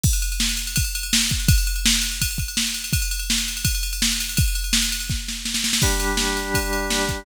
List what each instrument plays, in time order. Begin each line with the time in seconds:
0.03 kick, crash
0.13 ride
0.22 ride
0.32 ride
0.40 snare
0.49 ride
0.57 ride
0.67 ride
0.76 kick, ride
0.84 ride
0.95 ride
1.03 ride
1.13 snare
1.21 ride
1.29 kick, ride
1.40 ride
1.48 kick, ride
1.58 ride
1.67 ride
1.76 ride
1.86 snare
1.94 ride
2.02 ride
2.11 ride
2.21 kick, ride
2.31 ride
2.38 kick, ride
2.48 ride
2.57 snare
2.67 ride
2.74 ride
2.84 ride
2.93 kick, ride
3.02 ride
3.11 ride
3.19 ride
3.30 snare
3.38 ride
3.48 ride
3.57 ride
3.65 kick, ride
3.75 ride
3.83 ride
3.93 ride
4.02 snare
4.12 ride
4.20 ride
4.29 ride
4.37 kick, ride
4.48 ride
4.55 ride
4.64 ride
4.73 snare
4.82 ride
4.92 ride
5.00 ride
5.10 kick, snare
5.28 snare
5.45 snare
5.54 snare
5.64 snare
5.73 snare
5.82 drawbar organ G3 D4 G4, kick, crash
6.00 ride
6.17 snare
6.37 ride
6.54 kick, ride
6.73 ride
6.90 snare
7.09 kick, ride